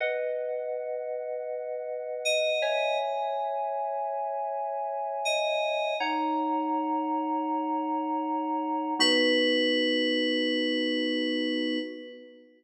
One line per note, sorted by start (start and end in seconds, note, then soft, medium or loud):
0.00 2.50 B4 medium
0.00 2.50 D#5 medium
0.00 2.50 F#5 medium
2.25 2.98 D#5 medium
2.62 5.94 C#5 loud
2.62 5.94 E5 medium
2.62 5.94 G#5 medium
5.25 5.97 D#5 medium
6.00 8.94 D#4 medium
6.00 8.94 C#5 medium
6.00 8.94 F#5 loud
6.00 8.94 A#5 loud
8.99 11.79 B3 loud
8.99 11.79 D#4 loud
8.99 11.79 F#4 loud
8.99 11.79 B4 loud